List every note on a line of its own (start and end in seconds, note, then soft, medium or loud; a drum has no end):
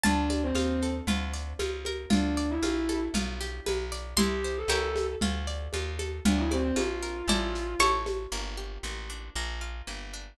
0.03 0.52 D2 medium
0.03 0.37 D4 loud
0.03 0.55 F4 loud
0.03 1.99 A5 medium
0.03 low conga medium
0.03 shaker medium
0.30 1.04 D5 medium
0.30 high conga medium
0.30 shaker medium
0.43 0.84 C4 medium
0.55 1.01 D#2 medium
0.55 1.04 F4 medium
0.55 high conga medium
0.55 shaker medium
0.82 1.07 A4 medium
0.82 shaker medium
1.07 1.54 D2 medium
1.07 1.59 F4 loud
1.07 low conga medium
1.07 shaker medium
1.34 2.07 D5 medium
1.34 shaker medium
1.59 2.06 C#2 medium
1.59 2.09 F4 medium
1.59 high conga medium
1.59 shaker medium
1.85 2.11 A#4 medium
1.85 high conga medium
1.85 shaker medium
2.10 2.59 D2 medium
2.10 2.46 D4 loud
2.10 2.62 F4 loud
2.10 low conga medium
2.10 shaker medium
2.37 3.11 D5 medium
2.37 shaker medium
2.50 2.99 E4 medium
2.62 3.09 A#1 medium
2.62 3.12 F4 medium
2.62 high conga medium
2.62 shaker medium
2.89 3.14 A4 medium
2.89 high conga medium
2.89 shaker medium
3.14 3.60 B1 medium
3.14 4.13 F4 loud
3.14 low conga medium
3.14 shaker medium
3.41 4.14 G4 medium
3.41 shaker medium
3.66 4.14 B1 medium
3.66 4.16 B4 medium
3.66 high conga medium
3.66 shaker medium
3.92 4.16 D5 medium
3.92 shaker medium
4.17 4.64 C2 medium
4.17 4.68 E4 loud
4.17 4.52 G4 loud
4.17 6.08 C6 medium
4.17 low conga medium
4.17 shaker medium
4.44 4.69 C5 medium
4.44 shaker medium
4.57 5.05 A4 medium
4.68 5.16 C#2 medium
4.68 5.16 E4 loud
4.68 5.16 G4 loud
4.68 5.16 A#4 loud
4.68 5.16 C#5 loud
4.68 high conga medium
4.68 shaker medium
4.96 high conga medium
4.96 shaker medium
5.21 5.68 D2 medium
5.21 5.73 F4 loud
5.21 low conga medium
5.21 shaker medium
5.47 6.21 D5 medium
5.47 shaker medium
5.73 6.20 D#2 medium
5.73 6.23 F4 medium
5.73 high conga medium
5.73 shaker medium
5.99 6.24 A4 medium
5.99 high conga medium
5.99 shaker medium
6.25 6.72 D2 medium
6.25 6.37 D4 loud
6.25 6.76 F4 loud
6.25 low conga loud
6.25 shaker medium
6.37 6.50 E4 medium
6.51 6.63 C4 loud
6.51 7.25 D5 medium
6.51 high conga medium
6.51 shaker medium
6.63 6.75 C4 loud
6.76 7.23 A#1 medium
6.76 7.25 F4 medium
6.76 7.75 F4 loud
6.76 high conga medium
6.76 shaker medium
7.02 7.27 A#4 medium
7.02 shaker medium
7.28 7.75 A1 medium
7.28 7.76 E4 loud
7.28 7.76 A4 loud
7.28 7.76 D5 loud
7.28 low conga medium
7.28 shaker medium
7.55 shaker medium
7.79 8.27 A1 medium
7.79 8.26 E4 loud
7.79 8.26 A4 loud
7.79 8.26 C#5 loud
7.79 8.28 C#6 medium
7.79 high conga medium
7.79 shaker medium
8.06 high conga medium
8.06 shaker medium
8.32 8.78 G1 medium
8.32 8.84 A#3 medium
8.57 9.31 G4 medium
8.83 9.30 A1 medium
8.83 9.33 A#3 medium
9.10 9.34 D4 medium
9.35 9.82 A#1 medium
9.35 9.87 A#3 medium
9.61 10.35 F4 medium
9.87 10.34 G1 medium
9.87 10.36 A#3 medium
10.13 10.38 D4 medium